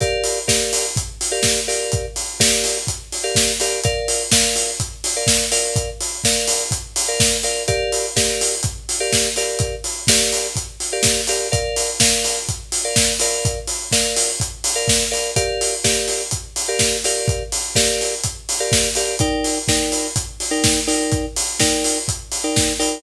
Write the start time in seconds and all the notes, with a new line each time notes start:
0.00 G4 A#4 D5 F5, kick, closed hi-hat
0.24 open hi-hat
0.48 G4 A#4 D5 F5, kick, snare
0.73 open hi-hat
0.96 kick, closed hi-hat
1.21 open hi-hat
1.31 G4 A#4 D5 F5
1.43 kick, snare
1.68 G4 A#4 D5 F5, open hi-hat
1.92 kick, closed hi-hat
2.16 open hi-hat
2.40 G4 A#4 D5 F5, kick, snare
2.64 open hi-hat
2.87 kick, closed hi-hat
3.12 open hi-hat
3.23 G4 A#4 D5 F5
3.35 kick, snare
3.60 G4 A#4 D5 F5, open hi-hat
3.84 A#4 D5 F5, kick, closed hi-hat
4.08 open hi-hat
4.32 A#4 D5 F5, kick, snare
4.56 open hi-hat
4.80 kick, closed hi-hat
5.04 open hi-hat
5.16 A#4 D5 F5
5.27 kick, snare
5.51 A#4 D5 F5, open hi-hat
5.76 kick, closed hi-hat
6.00 open hi-hat
6.24 A#4 D5 F5, kick, snare
6.48 open hi-hat
6.71 kick, closed hi-hat
6.96 open hi-hat
7.08 A#4 D5 F5
7.20 kick, snare
7.43 A#4 D5 F5, open hi-hat
7.68 G4 A#4 D5 F5, kick, closed hi-hat
7.92 open hi-hat
8.16 G4 A#4 D5 F5, kick, snare
8.41 open hi-hat
8.63 kick, closed hi-hat
8.89 open hi-hat
9.00 G4 A#4 D5 F5
9.12 kick, snare
9.36 G4 A#4 D5 F5, open hi-hat
9.59 kick, closed hi-hat
9.84 open hi-hat
10.07 G4 A#4 D5 F5, kick, snare
10.32 open hi-hat
10.56 kick, closed hi-hat
10.80 open hi-hat
10.92 G4 A#4 D5 F5
11.03 kick, snare
11.27 G4 A#4 D5 F5, open hi-hat
11.52 A#4 D5 F5, kick, closed hi-hat
11.76 open hi-hat
12.00 A#4 D5 F5, kick, snare
12.24 open hi-hat
12.49 kick, closed hi-hat
12.72 open hi-hat
12.84 A#4 D5 F5
12.96 kick, snare
13.19 A#4 D5 F5, open hi-hat
13.45 kick, closed hi-hat
13.67 open hi-hat
13.92 A#4 D5 F5, kick, snare
14.16 open hi-hat
14.40 kick, closed hi-hat
14.64 open hi-hat
14.75 A#4 D5 F5
14.88 kick, snare
15.11 A#4 D5 F5, open hi-hat
15.36 G4 A#4 D5 F5, kick, closed hi-hat
15.61 open hi-hat
15.84 G4 A#4 D5 F5, kick, snare
16.08 open hi-hat
16.31 kick, closed hi-hat
16.56 open hi-hat
16.68 G4 A#4 D5 F5
16.79 kick, snare
17.04 G4 A#4 D5 F5, open hi-hat
17.28 kick, closed hi-hat
17.52 open hi-hat
17.75 G4 A#4 D5 F5, kick, snare
18.01 open hi-hat
18.24 kick, closed hi-hat
18.49 open hi-hat
18.60 G4 A#4 D5 F5
18.72 kick, snare
18.95 G4 A#4 D5 F5, open hi-hat
19.19 D#4 A#4 D5 G5, kick, closed hi-hat
19.44 open hi-hat
19.68 D#4 A#4 D5 G5, kick, snare
19.92 open hi-hat
20.16 kick, closed hi-hat
20.40 open hi-hat
20.51 D#4 A#4 D5 G5
20.64 kick, snare
20.87 D#4 A#4 D5 G5, open hi-hat
21.12 kick, closed hi-hat
21.36 open hi-hat
21.59 D#4 A#4 D5 G5, kick, snare
21.84 open hi-hat
22.08 kick, closed hi-hat
22.32 open hi-hat
22.44 D#4 A#4 D5 G5
22.56 kick, snare
22.79 D#4 A#4 D5 G5, open hi-hat